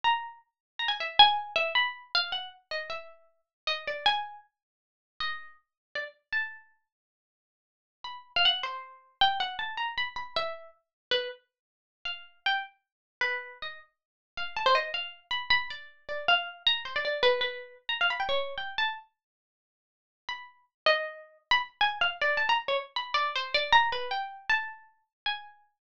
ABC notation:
X:1
M:9/8
L:1/16
Q:3/8=105
K:none
V:1 name="Pizzicato Strings"
^a4 z4 a ^g e2 g4 e2 | b4 f2 ^f2 z2 ^d2 e6 | z2 ^d2 =d2 ^g4 z8 | ^d4 z4 =d z3 a6 |
z12 b3 f ^f2 | c6 g2 ^f2 a2 ^a2 b z b2 | e4 z4 B2 z8 | f4 g2 z6 B4 ^d2 |
z6 f2 a c ^d2 f3 z b2 | b2 d4 d2 f4 ^a2 c d d2 | B2 B4 z ^a f b g ^c3 g2 =a2 | z14 b4 |
z2 ^d6 z b z2 ^g2 f z =d2 | a ^a z ^c z2 b2 d2 =c2 d2 a2 B2 | g4 a6 z2 ^g6 |]